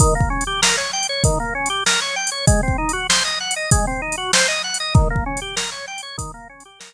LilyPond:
<<
  \new Staff \with { instrumentName = "Drawbar Organ" } { \time 4/4 \key ees \major \tempo 4 = 97 ees16 bes16 des'16 g'16 bes'16 des''16 g''16 des''16 ees16 bes16 des'16 g'16 bes'16 des''16 g''16 des''16 | aes16 c'16 ees'16 ges'16 c''16 ees''16 ges''16 ees''16 aes16 c'16 ees'16 ges'16 c''16 ees''16 ges''16 ees''16 | ees16 bes16 des'16 g'16 bes'16 des''16 g''16 des''16 ees16 bes16 des'16 g'16 bes'16 r8. | }
  \new DrumStaff \with { instrumentName = "Drums" } \drummode { \time 4/4 \tuplet 3/2 { <hh bd>8 bd8 hh8 sn8 r8 hh8 <hh bd>8 r8 hh8 sn8 r8 hh8 } | \tuplet 3/2 { <hh bd>8 bd8 hh8 sn8 r8 hh8 <hh bd>8 r8 hh8 sn8 r8 hh8 } | \tuplet 3/2 { <hh bd>8 bd8 hh8 sn8 r8 hh8 <hh bd>8 r8 hh8 } sn4 | }
>>